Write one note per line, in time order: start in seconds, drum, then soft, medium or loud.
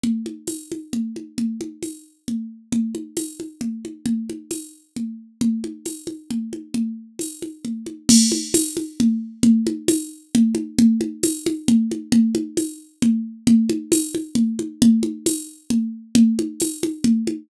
0.03 low conga loud
0.26 high conga medium
0.47 tambourine medium
0.47 high conga medium
0.72 high conga medium
0.93 low conga medium
1.16 high conga medium
1.38 low conga loud
1.61 high conga medium
1.83 tambourine medium
1.83 high conga medium
2.28 low conga medium
2.72 low conga loud
2.95 high conga medium
3.17 tambourine medium
3.17 high conga medium
3.40 high conga medium
3.61 low conga medium
3.85 high conga medium
4.06 low conga loud
4.29 high conga medium
4.51 tambourine medium
4.51 high conga medium
4.96 low conga medium
5.41 low conga loud
5.64 high conga medium
5.86 tambourine medium
5.86 high conga medium
6.07 high conga medium
6.31 low conga medium
6.53 high conga medium
6.74 low conga loud
7.19 tambourine medium
7.19 high conga medium
7.42 high conga medium
7.65 low conga medium
7.86 high conga medium
8.09 crash loud
8.09 low conga loud
8.32 high conga loud
8.54 tambourine loud
8.54 high conga loud
8.77 high conga loud
9.00 low conga loud
9.43 low conga loud
9.67 high conga loud
9.88 tambourine loud
9.88 high conga loud
10.35 low conga loud
10.55 high conga loud
10.79 low conga loud
11.01 high conga loud
11.23 tambourine loud
11.23 high conga loud
11.46 high conga loud
11.68 low conga loud
11.91 high conga medium
12.12 low conga loud
12.35 high conga loud
12.57 tambourine medium
12.57 high conga loud
13.02 low conga loud
13.47 low conga loud
13.69 high conga loud
13.92 tambourine loud
13.92 high conga loud
14.15 high conga loud
14.35 low conga loud
14.59 high conga medium
14.82 low conga loud
15.03 high conga loud
15.26 tambourine loud
15.26 high conga loud
15.70 low conga loud
16.15 low conga loud
16.39 high conga loud
16.60 tambourine loud
16.60 high conga loud
16.83 high conga loud
17.04 low conga loud
17.27 high conga loud